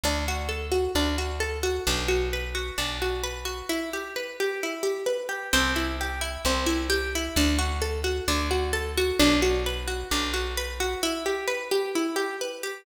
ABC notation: X:1
M:4/4
L:1/8
Q:1/4=131
K:G
V:1 name="Pizzicato Strings"
D F A F D F A F | D F B F D F B F | E G B G E G B G | C E G E C E G E |
D F A F D F A F | D F B F D F B F | E G B G E G B G |]
V:2 name="Electric Bass (finger)" clef=bass
D,,4 D,,4 | B,,,4 B,,,4 | z8 | C,,4 C,,4 |
D,,4 D,,4 | B,,,4 B,,,4 | z8 |]